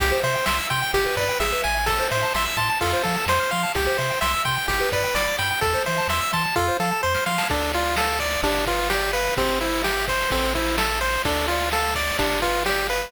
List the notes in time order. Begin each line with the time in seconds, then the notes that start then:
0.00 C2 G4, kick, ride
0.12 C5
0.23 C3 C5 E5, ride
0.35 G5
0.46 C2 E5 C6, snare
0.59 E6
0.70 C3 G5 C6, kick, ride
0.82 G5
0.94 G1 G4, kick, ride
1.06 B4
1.17 G2 B4 D5, kick, ride
1.29 G5
1.40 G#1 G#4 E5, snare
1.52 B4
1.63 A1 E5 G#5, ride
1.76 G#5
1.86 A4, kick, ride
1.99 C5
2.10 A2 C5 E5, ride
2.23 A5
2.34 A1 E5 C6, snare
2.46 E6
2.57 A2 A5 C6, kick, ride
2.70 A5
2.81 F2 F4 A4, kick, ride
2.93 C5
3.03 F3 A4 F5, kick, ride
3.16 A5
3.26 F2 C5 C6, snare
3.40 F6
3.51 F3 F5 C6, ride
3.63 A5
3.75 C2 G4, kick, ride
3.87 C5
3.98 C3 C5 E5, ride
4.10 G5
4.21 C2 E5 C6, snare
4.34 E6
4.45 C3 G5 C6, kick, ride
4.57 G5
4.68 G1 G4, kick, ride
4.80 B4
4.91 G2 B4 D5, kick, ride
5.04 G5
5.15 G1 D5 B5, snare
5.27 D6
5.38 G2 G5 B5, ride
5.51 G5
5.61 E2 A4, kick, ride
5.74 C5
5.86 E3 C5 E5, ride
5.98 A5
6.08 E2 E5 C6, snare
6.21 E6
6.33 E3 A5 C6, kick, ride
6.45 A5
6.56 F2 F4 A4, kick, snare
6.68 C5
6.80 F3 A4 F5, snare
6.92 A5
7.03 F2 C5 C6, snare
7.14 F6, snare
7.26 F3 F5 C6, snare
7.38 A5, snare
7.50 D2 D4 A4, kick, crash
7.61 ride
7.73 F4 D5, ride
7.86 ride
7.96 A4 F5, snare
8.10 ride
8.20 D5, kick, ride
8.32 ride
8.43 G1 D4 G4, kick, ride
8.55 ride
8.66 F4 B4, kick, ride
8.79 ride
8.90 G4 D5, snare
9.02 ride
9.13 B4 F5, ride
9.26 ride
9.37 G1 C4 G4, kick, ride
9.48 ride
9.61 E4 C5, ride
9.73 ride
9.84 G4 E5, snare
9.97 ride
10.08 C5, kick, ride
10.20 ride
10.30 A1 C4 A4, kick, ride
10.43 ride
10.55 E4 C5, kick, ride
10.66 ride
10.78 A4 E5, snare
10.89 ride
11.01 C5, ride
11.13 ride
11.25 D2 D4 A4, kick, ride
11.37 ride
11.48 F4 D5, ride
11.60 ride
11.71 A4 F5, snare
11.83 ride
11.95 D5, kick, ride
12.08 ride
12.19 G1 D4 G4, kick, ride
12.30 ride
12.42 F4 B4, kick, ride
12.54 ride
12.66 G4 D5, snare
12.77 ride
12.88 B4 F5, ride
13.01 ride